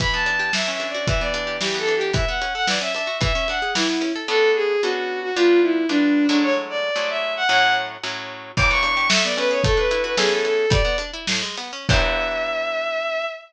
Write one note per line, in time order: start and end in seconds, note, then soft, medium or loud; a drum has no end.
0.00 0.50 E3 medium
0.00 0.11 B5 loud
0.00 kick medium
0.00 closed hi-hat medium
0.13 0.52 B3 medium
0.13 0.51 A5 medium
0.26 0.52 D4 medium
0.26 closed hi-hat medium
0.39 0.52 G4 medium
0.53 1.05 E3 medium
0.53 0.71 E5 medium
0.53 snare medium
0.68 1.06 C#4 medium
0.68 0.86 E5 medium
0.80 1.06 D4 medium
0.80 closed hi-hat medium
0.89 1.06 D5 medium
0.94 1.07 F#4 medium
1.07 1.58 E3 medium
1.07 1.20 E5 medium
1.07 kick medium
1.07 closed hi-hat medium
1.21 1.59 B3 medium
1.21 1.56 D5 medium
1.34 1.59 D4 medium
1.34 closed hi-hat medium
1.47 1.60 G4 medium
1.61 2.12 E3 loud
1.61 1.77 G4 medium
1.61 snare medium
1.74 2.12 B3 medium
1.79 1.94 A4 loud
1.87 2.12 D4 medium
1.87 closed hi-hat medium
1.96 2.11 G4 loud
2.01 2.14 G4 medium
2.13 2.25 E3 medium
2.13 2.27 E5 medium
2.13 kick medium
2.13 closed hi-hat medium
2.28 2.40 B3 medium
2.28 2.53 F#5 medium
2.41 2.54 C#4 medium
2.41 closed hi-hat medium
2.54 2.67 A4 medium
2.54 2.66 F#5 loud
2.67 2.80 E3 medium
2.67 2.80 D5 medium
2.67 snare medium
2.81 2.93 C#4 medium
2.81 2.93 E5 medium
2.95 3.08 D4 medium
2.95 3.17 E5 medium
2.95 closed hi-hat medium
3.07 3.19 F#4 medium
3.21 3.33 E3 loud
3.21 3.48 E5 loud
3.21 kick medium
3.21 closed hi-hat medium
3.35 3.47 C#4 medium
3.48 3.61 D4 medium
3.48 3.71 F#5 medium
3.48 closed hi-hat medium
3.62 3.74 G#4 medium
3.75 3.87 E3 loud
3.75 4.12 E4 medium
3.75 snare medium
3.90 4.02 B3 medium
4.01 4.13 C#4 medium
4.01 closed hi-hat medium
4.16 4.28 A4 medium
4.28 4.76 B3 loud
4.28 4.76 C#4 medium
4.28 4.76 D4 medium
4.28 4.76 A4 medium
4.28 4.50 A4 loud
4.55 4.81 G#4 loud
4.82 5.31 B3 medium
4.82 5.31 C#4 medium
4.82 5.31 D4 medium
4.82 5.20 F#4 loud
4.82 5.31 A4 medium
5.22 5.34 F#4 loud
5.36 5.85 G3 medium
5.36 5.85 B3 medium
5.36 5.85 D4 medium
5.36 5.60 F4 loud
5.36 5.85 F4 medium
5.62 5.86 E4 medium
5.89 6.27 G3 medium
5.89 6.27 B3 medium
5.89 6.27 D4 medium
5.89 6.26 D4 loud
5.89 6.27 F4 medium
6.29 6.91 F#3 medium
6.29 6.91 G#3 medium
6.29 6.91 A3 medium
6.29 6.42 D4 loud
6.29 6.91 E4 medium
6.43 6.54 C#5 loud
6.70 7.09 D5 loud
6.96 7.44 F#3 medium
6.96 7.44 G#3 medium
6.96 7.44 A3 medium
6.96 7.44 E4 medium
7.10 7.34 E5 medium
7.37 7.49 F#5 loud
7.49 7.97 A2 medium
7.49 7.97 F#3 medium
7.49 7.97 C#4 medium
7.49 7.97 E4 medium
7.49 7.74 F#5 loud
8.03 8.52 A2 medium
8.03 8.52 F#3 medium
8.03 8.52 C#4 medium
8.03 8.52 E4 medium
8.57 9.08 E3 loud
8.57 8.70 D6 loud
8.57 kick medium
8.57 crash loud
8.71 9.09 B3 medium
8.71 9.08 C#6 loud
8.83 9.09 D4 medium
8.83 closed hi-hat medium
8.97 9.09 G4 medium
9.10 9.60 A3 loud
9.10 9.24 E5 loud
9.10 snare loud
9.24 9.63 B3 medium
9.24 9.36 D5 medium
9.37 9.63 C#4 medium
9.37 9.50 B4 loud
9.37 closed hi-hat medium
9.51 9.63 G#4 medium
9.51 9.62 C#5 medium
9.64 10.15 A3 medium
9.64 9.77 A4 loud
9.64 kick loud
9.64 closed hi-hat medium
9.77 10.15 D4 medium
9.77 10.01 B4 medium
9.91 10.16 E4 medium
9.91 closed hi-hat medium
10.04 10.17 F#4 medium
10.04 10.15 B4 medium
10.17 10.66 E3 medium
10.17 10.66 B3 medium
10.17 10.66 C#4 medium
10.17 10.66 G#4 loud
10.17 10.30 G#4 loud
10.17 10.66 A4 loud
10.17 snare medium
10.31 10.43 A4 medium
10.45 10.70 A4 medium
10.45 closed hi-hat medium
10.70 10.82 G3 loud
10.70 10.96 D5 loud
10.70 kick loud
10.70 closed hi-hat loud
10.85 10.97 B3 medium
10.98 11.11 D4 medium
10.98 closed hi-hat medium
11.13 11.26 E4 medium
11.27 11.42 A2 medium
11.27 snare loud
11.42 11.56 G#3 medium
11.58 11.72 B3 medium
11.58 closed hi-hat medium
11.73 11.87 C#4 medium
11.89 13.26 E3 medium
11.89 13.26 B3 loud
11.89 13.26 D4 medium
11.89 13.26 G4 medium
11.89 13.25 E5 loud
11.89 kick loud
11.89 crash loud